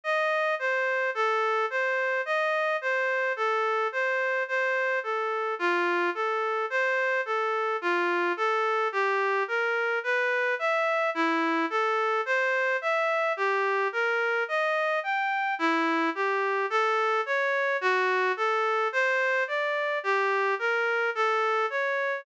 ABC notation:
X:1
M:4/4
L:1/8
Q:1/4=54
K:Gm
V:1 name="Clarinet"
e c A c e c A c | c A F A c A F A | G B =B =e =E A c e | G B e g =E G A ^c |
^F A c d G B A ^c |]